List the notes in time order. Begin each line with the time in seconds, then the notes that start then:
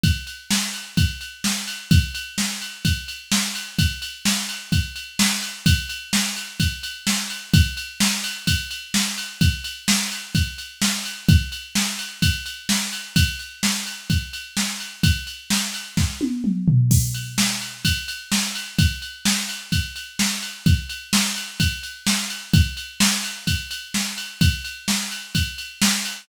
0.04 kick, ride
0.27 ride
0.51 snare
0.74 ride
0.97 kick, ride
1.21 ride
1.44 snare
1.67 ride
1.91 kick, ride
2.15 ride
2.38 snare
2.61 ride
2.85 kick, ride
3.08 ride
3.32 snare
3.55 ride
3.79 kick, ride
4.02 ride
4.25 snare
4.49 ride
4.72 kick, ride
4.96 ride
5.19 snare
5.43 ride
5.66 kick, ride
5.89 ride
6.13 snare
6.36 ride
6.60 kick, ride
6.83 ride
7.07 snare
7.30 ride
7.54 kick, ride
7.77 ride
8.00 snare
8.24 ride
8.47 kick, ride
8.71 ride
8.94 snare
9.18 ride
9.41 kick, ride
9.64 ride
9.88 snare
10.11 ride
10.35 kick, ride
10.58 ride
10.82 snare
11.05 ride
11.29 kick, ride
11.52 ride
11.75 snare
11.99 ride
12.22 kick, ride
12.46 ride
12.69 snare
12.92 ride
13.16 kick, ride
13.39 ride
13.63 snare
13.86 ride
14.10 kick, ride
14.33 ride
14.57 snare
14.80 ride
15.03 kick, ride
15.27 ride
15.50 snare
15.74 ride
15.97 kick, snare
16.21 high tom
16.44 mid tom
16.68 floor tom
16.91 kick, crash
17.14 ride
17.38 snare
17.61 ride
17.85 kick, ride
18.08 ride
18.32 snare
18.55 ride
18.79 kick, ride
19.02 ride
19.25 snare
19.49 ride
19.72 kick, ride
19.96 ride
20.19 snare
20.42 ride
20.66 kick, ride
20.89 ride
21.13 snare
21.36 ride
21.60 kick, ride
21.83 ride
22.07 snare
22.30 ride
22.53 kick, ride
22.77 ride
23.00 snare
23.24 ride
23.47 kick, ride
23.71 ride
23.94 snare
24.18 ride
24.41 kick, ride
24.65 ride
24.88 snare
25.11 ride
25.35 kick, ride
25.58 ride
25.82 snare
26.05 ride